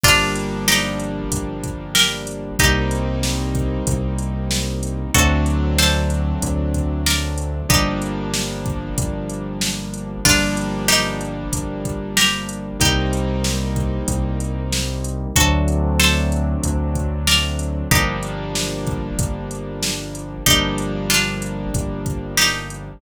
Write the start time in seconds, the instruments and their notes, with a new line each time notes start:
0.03 synth bass 1 G1, acoustic grand piano F3 G3 A#3 D4, pizzicato strings D4 F4, kick, crash
0.36 closed hi-hat
0.68 pizzicato strings D#4 G4, snare
1.00 closed hi-hat
1.32 synth bass 1 G1, kick, closed hi-hat
1.64 kick, closed hi-hat
1.95 pizzicato strings G4 A#4, snare
2.27 closed hi-hat
2.59 synth bass 1 C2, acoustic grand piano G3 A#3 C4 D#4, pizzicato strings D#4 G4, kick, closed hi-hat
2.91 closed hi-hat
3.23 snare
3.55 kick, closed hi-hat
3.87 synth bass 1 C2, kick, closed hi-hat
4.18 closed hi-hat
4.51 snare
4.83 closed hi-hat
5.14 synth bass 1 D2, acoustic grand piano F#3 A3 C4 D4, pizzicato strings F#4 A4, kick, closed hi-hat
5.46 closed hi-hat
5.78 pizzicato strings A4 C5, snare
6.10 closed hi-hat
6.42 synth bass 1 D2, kick, closed hi-hat
6.74 kick, closed hi-hat
7.06 pizzicato strings A#4 D5, snare
7.38 closed hi-hat
7.69 synth bass 1 G1, acoustic grand piano F3 G3 A#3 D4, pizzicato strings D#4 G4, kick, closed hi-hat
8.02 closed hi-hat
8.34 snare
8.66 kick, closed hi-hat
8.98 synth bass 1 G1, kick, closed hi-hat
9.30 closed hi-hat
9.61 snare
9.94 closed hi-hat
10.25 synth bass 1 G1, acoustic grand piano F3 G3 A#3 D4, pizzicato strings D4 F4, kick, crash
10.57 closed hi-hat
10.88 pizzicato strings D#4 G4, snare
11.21 closed hi-hat
11.53 synth bass 1 G1, kick, closed hi-hat
11.85 kick, closed hi-hat
12.17 pizzicato strings G4 A#4, snare
12.49 closed hi-hat
12.80 synth bass 1 C2, acoustic grand piano G3 A#3 C4 D#4, pizzicato strings D#4 G4, kick, closed hi-hat
13.13 closed hi-hat
13.44 snare
13.76 kick, closed hi-hat
14.08 synth bass 1 C2, kick, closed hi-hat
14.40 closed hi-hat
14.72 snare
15.04 closed hi-hat
15.36 synth bass 1 D2, acoustic grand piano F#3 A3 C4 D4, pizzicato strings F#4 A4, kick, closed hi-hat
15.68 closed hi-hat
15.99 pizzicato strings A4 C5, snare
16.32 closed hi-hat
16.63 synth bass 1 D2, kick, closed hi-hat
16.95 kick, closed hi-hat
17.27 pizzicato strings A#4 D5, snare
17.59 closed hi-hat
17.91 synth bass 1 G1, acoustic grand piano F3 G3 A#3 D4, pizzicato strings D#4 G4, kick, closed hi-hat
18.23 closed hi-hat
18.55 snare
18.87 kick, closed hi-hat
19.18 synth bass 1 G1, kick, closed hi-hat
19.51 closed hi-hat
19.83 snare
20.15 closed hi-hat
20.46 synth bass 1 G1, acoustic grand piano F3 G3 A#3 D4, pizzicato strings D#4 G4, kick, closed hi-hat
20.78 closed hi-hat
21.10 pizzicato strings D4 F4, snare
21.42 closed hi-hat
21.74 synth bass 1 G1, kick, closed hi-hat
22.06 kick, closed hi-hat
22.37 pizzicato strings D#4 G4, snare
22.70 closed hi-hat